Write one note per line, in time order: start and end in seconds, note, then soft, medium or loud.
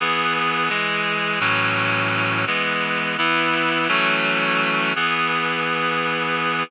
0.00 0.69 E3 loud
0.00 0.70 B3 loud
0.00 0.69 G#4 loud
0.69 1.39 E3 medium
0.69 1.39 G#3 loud
0.69 1.39 G#4 medium
1.40 2.45 A2 loud
1.40 2.45 E3 medium
1.40 2.45 F#3 loud
1.40 2.45 C#4 loud
2.47 3.17 E3 medium
2.47 3.17 G#3 loud
2.47 3.17 B3 medium
3.18 3.88 E3 loud
3.18 3.88 B3 loud
3.18 3.88 E4 loud
3.88 4.93 E3 medium
3.88 4.93 F#3 loud
3.88 4.93 A3 loud
3.88 4.93 C#4 loud
4.96 6.63 E3 loud
4.96 6.63 B3 loud
4.96 6.63 G#4 medium